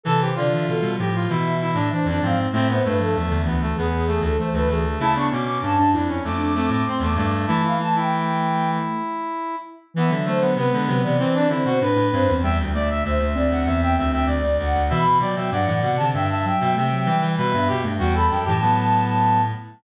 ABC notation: X:1
M:4/4
L:1/16
Q:1/4=97
K:Am
V:1 name="Flute"
A c d e A2 z2 e3 e c d f z | e c B A e2 z2 ^G3 A c B G z | a ^c' d' d' a2 z2 d'3 d' =c' d' d' z | a f a g5 z8 |
[K:Em] e2 c2 B2 B d c d c c B2 c2 | g2 e2 c2 d f e g e g d2 f2 | b2 g2 f2 f a g a g g g2 g2 | e3 g g b g a7 z2 |]
V:2 name="Brass Section"
A G F4 G F E2 E D D D C2 | C B, A,4 B, A, B,2 A, A, A, A, A,2 | E D ^C4 D C A,2 A, A, =C A, A,2 | E E z E11 z2 |
[K:Em] B, z A, B, B,4 C D E F B4 | e z d e e4 e e e e d4 | e z d e d4 e e e e e4 | B2 G z F A2 G B,6 z2 |]
V:3 name="Ocarina"
C,2 C, E, E, G, F,2 E,4 E,2 F, z | A,2 A, F, F, D, E,2 E,4 E,2 E, z | A, B,2 z D D E2 z D C2 A,2 G,2 | A,2 A,10 z4 |
[K:Em] E, F,2 F, z ^G, F, E, C2 C2 D2 C C | G,2 A,2 A, A, C8 z2 | E, E, F, F, F, E, C, D,2 z F,2 A, F, G,2 | G, B, z A, G, G, z E, F,6 z2 |]
V:4 name="Clarinet" clef=bass
E,2 D,2 B,, B,, A,,2 B,,3 A,, z F,, ^G,,2 | A,,2 G,,2 E,, E,, D,,2 E,,3 D,, z D,, D,,2 | ^C,2 B,,2 G,, G,, F,,2 F,,3 A,, z E,, G,,2 | E,10 z6 |
[K:Em] E, D,3 C, D, C, C, E,2 D, B,, A,, A,, G,, E,, | E,, D,,3 D,, D,, D,, D,, E,,2 D,, D,, D,, D,, D,, D,, | B,,2 B,, B,, G,, A,, B,, C, G,,3 B,, C,2 E, E, | B,, G,, B,, G,, E,,2 F,, A,,7 z2 |]